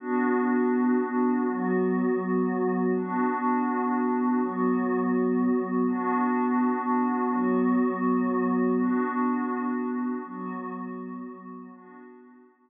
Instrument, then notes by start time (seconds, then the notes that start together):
pad 5 (bowed)
0.00 B3 D4 F#4
1.47 F#3 B3 F#4
2.94 B3 D4 F#4
4.39 F#3 B3 F#4
5.87 B3 D4 F#4
7.31 F#3 B3 F#4
8.78 B3 D4 F#4
10.25 F#3 B3 F#4
11.70 B3 D4 F#4